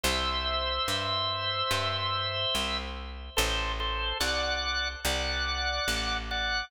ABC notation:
X:1
M:4/4
L:1/8
Q:1/4=72
K:Em
V:1 name="Drawbar Organ"
[ce]8 | [Ac] [Ac] [df]2 [df]3 [df] |]
V:2 name="Electric Bass (finger)" clef=bass
C,,2 G,,2 G,,2 C,,2 | A,,,2 C,,2 C,,2 A,,,2 |]